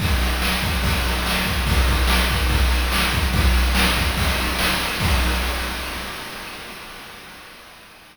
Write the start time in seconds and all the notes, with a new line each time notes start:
0.00 kick, ride
0.20 ride
0.42 snare
0.62 kick, ride
0.83 kick, ride
1.05 ride
1.26 snare
1.45 kick, ride
1.66 kick, ride
1.87 kick, ride
2.07 snare
2.29 kick, ride
2.49 kick, ride
2.70 ride
2.92 snare
3.13 kick, ride
3.33 kick, ride
3.54 ride
3.75 snare
3.96 kick, ride
4.17 kick, ride
4.37 ride
4.59 snare
4.80 ride
5.00 kick, crash